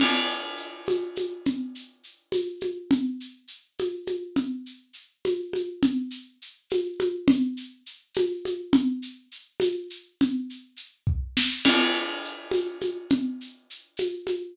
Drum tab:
CC |x----|-----|-----|-----|
TB |---x-|---x-|---x-|---x-|
SH |xxxxx|xxxxx|xxxxx|xxxxx|
SD |-----|-----|-----|-----|
CG |O--oo|O--oo|O--oo|O--oo|
BD |-----|-----|-----|-----|

CC |-----|-----|-----|-----|
TB |---x-|---x-|---x-|-----|
SH |xxxxx|xxxxx|xxxxx|xxx--|
SD |-----|-----|-----|----o|
CG |O--oo|O--oo|O--o-|O----|
BD |-----|-----|-----|---o-|

CC |x----|-----|
TB |---x-|---x-|
SH |xxxxx|xxxxx|
SD |-----|-----|
CG |O--oo|O--oo|
BD |-----|-----|